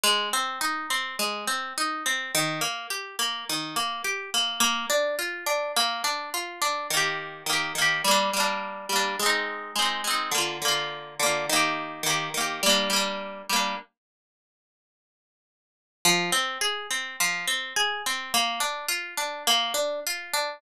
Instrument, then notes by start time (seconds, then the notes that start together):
orchestral harp
0.03 G#3
0.33 C4
0.61 D#4
0.90 C4
1.19 G#3
1.47 C4
1.78 D#4
2.06 C4
2.35 D#3
2.61 A#3
2.90 G4
3.19 A#3
3.49 D#3
3.76 A#3
4.04 G4
4.34 A#3
4.60 A#3
4.90 D4
5.19 F4
5.46 D4
5.76 A#3
6.04 D4
6.34 F4
6.62 D4
6.90 D#3 A#3
6.97 G4
7.46 D#3 A#3
7.53 G4
7.75 D#3 A#3
7.82 G4
8.04 G3 A#3
8.11 D4
8.33 G3 A#3
8.40 D4
8.89 G3 A#3
8.96 D4
9.19 G#3 C4
9.26 D#4
9.76 G#3 C4
9.82 D#4
10.04 G#3 C4
10.11 D#4
10.31 D3 A#3
10.38 F4
10.62 D3 A#3
10.68 F4
11.19 D3 A#3
11.26 F4
11.49 D#3 A#3
11.56 G4
12.03 D#3 A#3
12.10 G4
12.34 D#3 A#3
12.41 G4
12.63 G3 A#3
12.69 D4
12.90 G3 A#3
12.96 D4
13.49 G3 A#3
13.56 D4
16.05 F3
16.32 C4
16.61 G#4
16.91 C4
17.20 F3
17.48 C4
17.76 G#4
18.06 C4
18.34 A#3
18.60 D4
18.88 F4
19.17 D4
19.47 A#3
19.74 D4
20.07 F4
20.33 D4